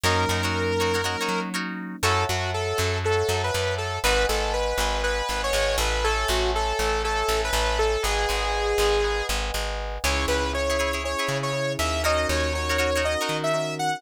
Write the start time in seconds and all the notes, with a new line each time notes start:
0.04 F#2 F#3 A#3 C#4 D#4 F#4 A#4 C#5
0.29 F#2 D#4 F#4 A#4 C#5
0.43 D#4 F#4 A#4 C#5
0.80 D#4 F#4 A#4 C#5
0.94 D#4 F#4 A#4 C#5
1.04 F#3 A#3 C#4 D#4 F#4 A#4 C#5
1.21 D#4 F#4 A#4 C#5
1.29 F#3
1.54 D#4 F#4 A#4 C#5
2.03 F#2 E4 F#4 A4 C#5 E5 F#5 A5
2.29 F#2 F#3 F#4
2.54 A4
2.78 F#2 F#3
3.04 A4 C#5 E5 F#5 A5
3.29 F#2 F#3
3.44 B4
3.54 F#2 F#3
3.78 A4
4.04 G#1 D#4 F#4 G#4 B4 D#5 F#5 G#5
4.29 G#1 G#3 A4
4.53 B4
4.78 G#1 G#3
5.03 B4 D#5 F#5 G#5
5.29 G#1 G#3
5.44 C#5
5.53 G#1 G#3
5.78 A1 A3 B4
6.04 A4 C#5 E5 G#5 A5
6.28 A1 A3 F#4
6.55 A4
6.79 A1 A3
7.04 A4 C#5 E5 G#5 A5
7.29 A1 A3
7.44 B4
7.53 A1 A3
7.79 A4
8.03 G#1 G#4 B4 D#5 F#5 G#5
8.29 G#1 G#3
8.78 G#1 G#3
9.04 B4 D#5 F#5 G#5
9.29 G#1 G#3
9.54 G#1 G#3
10.04 C#2 C#4 E4 G#4 C#5
10.28 C#2 B4
10.53 C#4 E4 G#4 C#5
10.70 E4 G#4 C#5
10.79 E4 G#4 C#5
10.93 E4 G#4 C#5
11.04 C#4 E4 G#4 C#5
11.19 E4 G#4 C#5
11.29 C#3
11.43 C#5
11.53 C#4 E4 G#4
11.79 D#2 E5
12.03 C#4 D#4 F#4 A#4 C#5 D#5
12.29 D#2 C#5
12.53 C#4 D#4 F#4 A#4 C#5
12.69 D#4 F#4 A#4 C#5
12.78 D#4 F#4 A#4 C#5
12.96 D#4 F#4 A#4 C#5
13.04 C#4 D#4 F#4 A#4 D#5
13.21 D#4 F#4 A#4 C#5
13.29 D#3
13.44 E5
13.54 C#4 D#4 F#4 A#4
13.79 F#5